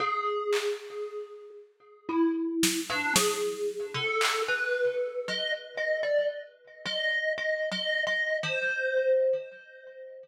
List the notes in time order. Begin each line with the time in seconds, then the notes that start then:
0.00 G#4
0.53 clap
2.09 E4
2.63 snare
2.90 D4
3.16 G#4, snare
3.95 A4
4.21 clap
4.48 B4
5.28 D#5
5.77 D#5
6.03 D5
6.86 D#5
7.38 D#5
7.71 D#5
8.07 D#5
8.43 C5